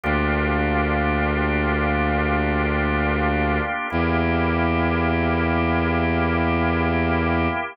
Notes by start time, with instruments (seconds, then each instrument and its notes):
0.04 violin D2, drawbar organ A#3 D4 F4 G4
3.90 violin E2, drawbar organ A#3 E4 G4